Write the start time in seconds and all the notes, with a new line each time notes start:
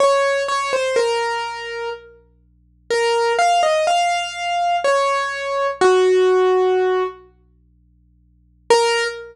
0.00 C#5
0.48 C#5
0.73 C5
0.96 A#4
2.91 A#4
3.39 F5
3.63 D#5
3.87 F5
4.84 C#5
5.81 F#4
8.70 A#4